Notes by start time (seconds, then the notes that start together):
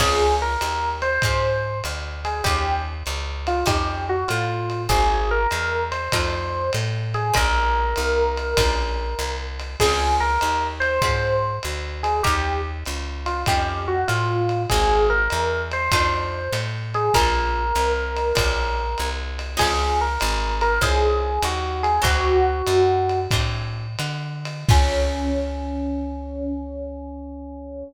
0.00 C#2 C4 C#4 F4 G#4, kick, crash, ride
0.42 A#4
0.61 D#2, hi-hat pedal, ride
1.02 C5, ride
1.22 G#2 C4 C#4 F4 G#4, kick, ride
1.84 D2, hi-hat pedal, ride
2.25 G#4, ride
2.44 D#2 C#4 D#4 F4 G4, kick, ride
3.06 C#2, hi-hat pedal, ride
3.47 F4, ride
3.66 F2 C#4 D#4 F4 G4, kick, ride
4.09 F#4
4.28 A2 F4, hi-hat pedal, ride
4.70 ride
4.89 G#1 A#3 C4 F#4 G#4, kick, ride
5.31 A#4
5.51 E2, hi-hat pedal, ride
5.92 C5, ride
6.12 F2 A3 D4 D#4 F4, kick, ride
6.73 A2, hi-hat pedal, ride
7.14 G#4, ride
7.34 A#1 G3 A#3 C#4 F4 A#4, kick, ride
7.96 C2, hi-hat pedal, ride
8.38 ride
8.57 A#1 G3 A#3 C#4 F4, kick, ride
9.19 C2, hi-hat pedal, ride
9.60 ride
9.80 C#2 C4 C#4 F4 G#4, kick, crash, ride
10.20 A#4
10.41 D#2, hi-hat pedal, ride
10.80 C5, ride
11.02 G#2 C4 C#4 F4 G#4, kick, ride
11.63 D2, hi-hat pedal, ride
12.03 G#4, ride
12.23 D#2 C#4 D#4 F4 G4, kick, ride
12.85 C#2, hi-hat pedal, ride
13.26 F4, ride
13.46 F2 C#4 D#4 F4 G4, kick, ride
13.88 F#4
14.08 A2 F4, hi-hat pedal, ride
14.49 ride
14.70 G#1 A#3 C4 F#4 G#4, kick, ride
15.10 A#4
15.30 E2, hi-hat pedal, ride
15.72 C5, ride
15.92 F2 A3 D4 D#4 F4, kick, ride
16.52 A2, hi-hat pedal, ride
16.94 G#4, ride
17.14 A#1 G3 A#3 C#4 F4 A#4, kick, ride
17.75 C2, hi-hat pedal, ride
18.17 ride
18.35 A#1 G3 A#3 C#4 F4, kick, ride
18.98 C2, hi-hat pedal, ride
19.39 ride
19.57 C#2 F3 G#3 C4 C#4 G#4, kick, crash, ride
20.01 A#4
20.20 G#1, hi-hat pedal, ride
20.61 A#4, ride
20.81 C2 F3 G#3 C4 C#4 G#4, kick, ride
21.42 D#2 F#4, hi-hat pedal, ride
21.83 G#4, ride
22.02 D2 E3 F#3 C4 D4 F#4, kick, ride
22.67 F#2, hi-hat pedal, ride
23.10 ride
23.31 A2 E3 F#3 C4 D4, kick, ride
23.99 D3, hi-hat pedal, ride
24.45 ride
24.69 C#2 C4 C#4 F4 G#4, kick, crash